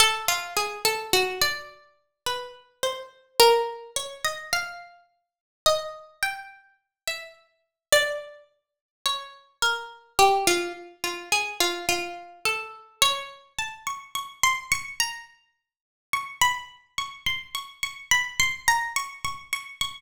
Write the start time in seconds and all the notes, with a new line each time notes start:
0.00 A4
0.28 F4
0.57 G#4
0.85 A4
1.13 F#4
1.42 D5
2.26 B4
2.83 C5
3.40 A#4
3.96 C#5
4.25 D#5
4.53 F5
5.66 D#5
6.23 G5
7.08 E5
7.92 D5
9.06 C#5
9.62 A#4
10.19 G4
10.47 F4
11.04 F4
11.32 G#4
11.60 F4
11.89 F4
12.45 A4
13.02 C#5
13.58 A5
13.87 C#6
14.15 C#6
14.43 C6
14.72 C#6
15.00 A#5
16.13 C#6
16.42 B5
16.98 C#6
17.26 C6
17.55 C#6
17.83 C#6
18.11 B5
18.40 C6
18.68 A#5
18.96 C#6
19.25 C#6
19.53 C#6
19.81 C#6